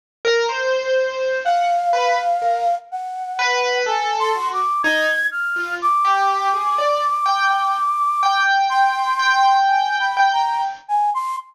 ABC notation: X:1
M:6/4
L:1/16
Q:1/4=62
K:none
V:1 name="Flute"
z6 f6 ^f4 (3^g2 c'2 d'2 ^g'2 =f'2 | d'12 c'4 (3^g2 b2 ^a2 z g c' z |]
V:2 name="Acoustic Grand Piano"
z ^A c4 ^f z B z A z3 B2 =A2 ^F z ^D z2 =F | z G2 ^G d z =g g z2 g4 g4 g g z4 |]